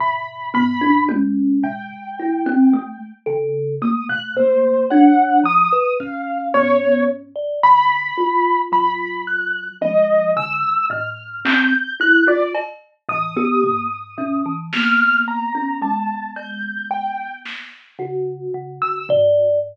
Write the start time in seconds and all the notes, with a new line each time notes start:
0.00 B2 B5, floor tom
0.54 B3 B5, floor tom
0.81 D4
1.09 C#4, high tom
1.63 A#2 G5
2.20 E4
2.46 C4
2.73 A3
3.26 C#3 A4
3.82 A3 A#3 D#6
4.09 B2 F#6
4.36 A#3 C5
4.90 D4 C#5 F#5
5.44 F3 D#6
5.72 B4
6.00 C#4 F5, kick
6.54 B3 C#5, floor tom
7.36 D5
7.63 D3 B5
8.17 F4
8.72 F#3 B5, floor tom
9.27 F#6
9.81 F3 D#5, high tom
10.36 D3 E6
10.90 A2 F6
11.45 C4 G6, clap
12.00 E4 F#6
12.27 F4 D5
12.55 cowbell
13.09 A2 E3 D#6
13.37 B3 G4
13.62 A#3, floor tom
14.18 B2 C#4
14.46 E3
14.73 A#3 B3 F6, snare
15.28 A#5
15.55 C#4
15.82 G#3 A5
16.36 G6, cowbell
16.90 G5
17.45 snare
17.99 C#3 F#4
18.54 C#3
18.82 D3 E6
19.09 D5, floor tom